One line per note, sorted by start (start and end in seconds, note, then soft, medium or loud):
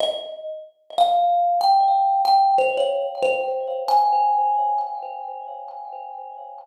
0.00 0.29 D#5 medium
0.98 1.59 F5 medium
1.61 2.19 G5 medium
2.25 2.54 G5 medium
2.58 2.76 C5 medium
2.77 3.06 C#5 medium
3.23 3.84 C5 medium
3.88 4.83 G#5 medium